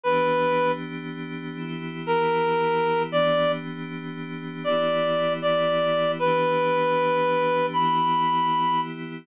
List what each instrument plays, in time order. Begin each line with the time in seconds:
0.04 pad 5 (bowed) E3 B3 D4 G4, clarinet B4
1.57 pad 5 (bowed) E3 B3 E4 G4
2.07 clarinet A#4
3.10 pad 5 (bowed) E3 B3 D4 G4, clarinet D5
4.64 pad 5 (bowed) E3 B3 E4 G4, clarinet D5
5.42 clarinet D5
6.19 pad 5 (bowed) E3 B3 D4 G4, clarinet B4
7.73 pad 5 (bowed) E3 B3 E4 G4, clarinet B5